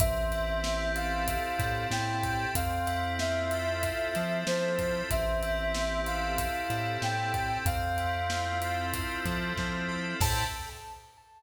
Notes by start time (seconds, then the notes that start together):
0.00 A1 C4 E5, kick, closed hi-hat
0.31 E4, closed hi-hat
0.64 G4, snare
0.95 A4 F5, closed hi-hat
1.27 C4, kick, closed hi-hat
1.59 A2 E4, kick, snare, closed hi-hat
1.90 A2 G4 G5, snare
2.23 A4, kick, closed hi-hat
2.55 F2 C4 F5, kick, closed hi-hat
2.86 E4, closed hi-hat
3.19 F4 E5, snare
3.51 A4, closed hi-hat
3.83 C4, kick, closed hi-hat
4.15 F3 E4, snare, closed hi-hat
4.47 F3 F4 C5, snare
4.79 A4, kick, closed hi-hat
5.10 A1 C4 E5, kick, closed hi-hat
5.42 E4, closed hi-hat
5.74 G4, snare
6.06 A4 F5, closed hi-hat
6.38 C4, kick, closed hi-hat
6.70 A2 E4, snare, closed hi-hat
7.01 A2 G4 G5, snare
7.34 A4, kick, closed hi-hat
7.65 F2 C4 F5, kick, closed hi-hat
7.98 E4, closed hi-hat
8.30 F4, snare
8.62 A4, closed hi-hat
8.94 C4, kick, closed hi-hat
9.25 F3 E4, kick, snare, closed hi-hat
9.57 F3 F4, kick, snare
9.88 A4
10.20 A2 C4 E4 G4 A4 A5, kick, crash